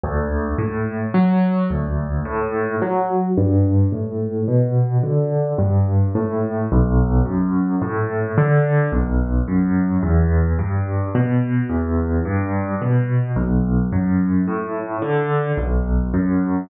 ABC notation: X:1
M:3/4
L:1/8
Q:1/4=54
K:Bm
V:1 name="Acoustic Grand Piano" clef=bass
D,, A,, F, D,, A,, F, | G,, A,, B,, D, G,, A,, | B,,, F,, A,, D, B,,, F,, | E,, G,, B,, E,, G,, B,, |
B,,, F,, A,, D, B,,, F,, |]